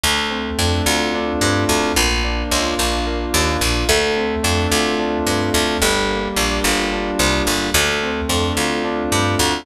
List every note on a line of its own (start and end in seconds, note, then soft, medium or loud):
0.03 0.50 D2 medium
0.03 1.68 A3 medium
0.30 1.41 C4 medium
0.58 0.82 F2 medium
0.58 1.14 D4 medium
0.86 1.33 D2 medium
0.86 1.91 F4 medium
1.14 1.93 D4 medium
1.41 1.65 G2 medium
1.41 1.94 C4 medium
1.68 1.92 D2 medium
1.68 1.95 A3 medium
1.96 2.43 A#1 medium
1.96 3.06 A#3 medium
2.24 2.79 D4 medium
2.51 2.75 C#2 medium
2.51 3.61 F4 medium
2.79 3.26 A#1 medium
2.79 3.34 D4 medium
3.06 3.85 A#3 medium
3.34 3.57 D#2 medium
3.34 3.86 D4 medium
3.61 3.85 A#1 medium
3.61 3.88 F4 medium
3.89 4.36 D2 loud
3.89 5.53 A3 medium
4.16 5.26 C4 medium
4.43 4.67 F2 medium
4.43 4.98 D4 medium
4.71 5.18 D2 medium
4.71 5.76 F4 medium
4.99 5.77 D4 medium
5.27 5.50 G2 medium
5.27 5.79 C4 medium
5.53 5.77 D2 medium
5.53 5.79 A3 medium
5.82 6.28 G1 medium
5.82 7.46 G3 medium
6.10 7.19 A#3 medium
6.36 6.60 A#1 medium
6.36 6.91 D4 medium
6.64 7.11 G1 medium
6.64 7.68 F4 medium
6.92 7.70 D4 medium
7.19 7.43 C2 medium
7.19 7.72 A#3 medium
7.47 7.70 G1 medium
7.47 7.73 G3 medium
7.74 8.21 D2 loud
7.74 9.40 A3 medium
8.03 9.12 C4 medium
8.29 8.53 F2 medium
8.29 8.83 D4 medium
8.57 9.04 D2 medium
8.57 9.62 F4 medium
8.84 9.62 D4 medium
9.12 9.35 G2 medium
9.12 9.64 C4 medium
9.39 9.63 D2 medium
9.39 9.65 A3 medium